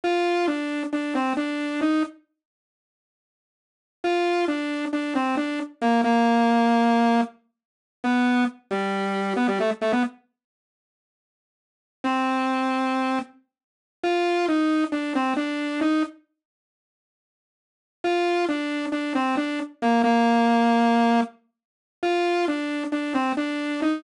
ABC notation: X:1
M:9/8
L:1/16
Q:3/8=90
K:Bb
V:1 name="Lead 2 (sawtooth)"
F4 D4 D2 C2 D4 E2 | z18 | F4 D4 D2 C2 D2 z2 B,2 | B,12 z6 |
[K:C] B,4 z2 G,6 B, G, A, z A, B, | z18 | C12 z6 | [K:Bb] F4 E4 D2 C2 D4 E2 |
z18 | F4 D4 D2 C2 D2 z2 B,2 | B,12 z6 | F4 D4 D2 C2 D4 E2 |]